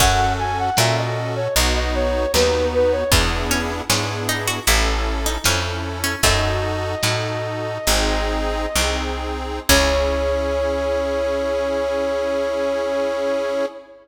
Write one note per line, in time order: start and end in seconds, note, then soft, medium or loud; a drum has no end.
0.00 0.70 F#2 medium
0.00 0.70 C#4 loud
0.00 2.50 C#4 medium
0.00 0.70 F#4 loud
0.00 0.70 A4 loud
0.00 0.33 F#5 loud
0.00 kick loud
0.00 crash loud
0.39 0.58 G#5 medium
0.59 0.77 F#5 medium
0.77 1.48 A#2 loud
0.77 1.48 C#4 medium
0.77 1.48 F#4 loud
0.77 1.48 A4 loud
0.77 0.96 E5 medium
0.77 snare loud
0.98 1.34 D#5 medium
1.36 1.54 C#5 medium
1.55 2.26 B1 medium
1.55 2.26 B3 loud
1.55 2.26 D#4 loud
1.55 2.26 F#4 loud
1.55 1.74 D#5 medium
1.55 closed hi-hat loud
1.76 1.94 D#5 medium
1.95 2.32 C#5 medium
2.34 3.04 D#2 medium
2.34 3.04 B3 loud
2.34 3.04 D#4 loud
2.34 3.04 F#4 medium
2.34 2.66 B4 medium
2.34 snare loud
2.74 2.92 B4 loud
2.92 3.10 C#5 medium
3.12 3.82 E2 medium
3.12 3.47 B3 medium
3.12 3.82 B3 loud
3.12 3.82 D4 loud
3.12 3.82 E4 loud
3.12 3.82 G#4 loud
3.12 kick loud
3.12 closed hi-hat loud
3.51 3.86 C#4 medium
3.89 4.60 G#2 medium
3.89 4.59 B3 medium
3.89 4.25 C#4 medium
3.89 4.59 D4 medium
3.89 4.59 E4 loud
3.89 4.59 G#4 medium
3.89 snare loud
4.29 4.46 D#4 medium
4.48 4.65 F#4 medium
4.67 5.38 A1 medium
4.67 5.38 C#4 loud
4.67 5.20 E4 medium
4.67 5.38 E4 loud
4.67 5.38 A4 loud
4.67 closed hi-hat loud
5.26 5.44 D#4 medium
5.44 6.15 F2 medium
5.44 6.15 C#4 loud
5.44 5.98 C#4 medium
5.44 6.15 E4 loud
5.44 6.15 A4 medium
5.44 snare loud
6.04 6.21 C#4 medium
6.23 6.95 F#2 loud
6.23 8.30 A3 medium
6.23 6.95 D#4 loud
6.23 6.95 F#4 loud
6.23 6.95 A4 loud
6.23 8.97 D#5 loud
6.23 kick loud
6.23 closed hi-hat loud
7.03 7.79 A2 medium
7.03 7.78 D#4 medium
7.03 7.78 F#4 medium
7.03 7.78 A4 medium
7.03 snare loud
7.87 8.67 G#1 medium
7.87 8.66 C4 loud
7.87 8.66 D#4 loud
7.87 8.66 G#4 loud
7.87 closed hi-hat loud
8.76 9.60 C2 medium
8.76 9.60 C4 loud
8.76 9.60 D#4 medium
8.76 9.60 G#4 loud
8.76 snare loud
9.69 13.65 C#2 loud
9.69 13.65 C#4 loud
9.69 13.66 C#4 loud
9.69 13.66 E4 medium
9.69 13.66 G#4 loud
9.69 13.65 C#5 loud
9.69 kick loud
9.69 crash loud